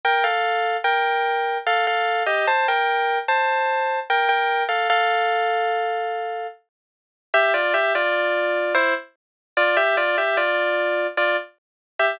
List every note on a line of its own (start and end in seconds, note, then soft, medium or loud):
0.05 0.24 A#4 medium
0.05 0.24 G5 medium
0.24 0.77 A4 medium
0.24 0.77 F5 medium
0.84 1.58 A#4 medium
0.84 1.58 G5 medium
1.67 1.86 A4 medium
1.67 1.86 F5 medium
1.87 2.23 A4 medium
1.87 2.23 F5 medium
2.26 2.46 G4 medium
2.26 2.46 D#5 medium
2.47 2.67 C5 medium
2.47 2.67 A5 medium
2.68 3.19 A#4 medium
2.68 3.19 G5 medium
3.28 3.99 C5 medium
3.28 3.99 A5 medium
4.10 4.28 A#4 medium
4.10 4.28 G5 medium
4.29 4.64 A#4 medium
4.29 4.64 G5 medium
4.69 4.88 A4 medium
4.69 4.88 F5 medium
4.90 6.47 A4 loud
4.90 6.47 F5 loud
7.34 7.53 G4 loud
7.34 7.53 E5 loud
7.54 7.73 F4 medium
7.54 7.73 D5 loud
7.74 7.93 G4 medium
7.74 7.93 E5 loud
7.95 8.73 F4 medium
7.95 8.73 D5 loud
8.74 8.94 E4 loud
8.74 8.94 C5 loud
9.57 9.76 F4 loud
9.57 9.76 D5 loud
9.77 9.96 G4 loud
9.77 9.96 E5 loud
9.97 10.16 F4 loud
9.97 10.16 D5 loud
10.18 10.37 G4 medium
10.18 10.37 E5 medium
10.37 11.07 F4 medium
10.37 11.07 D5 loud
11.17 11.36 F4 medium
11.17 11.36 D5 medium
11.99 12.19 G4 medium
11.99 12.19 E5 loud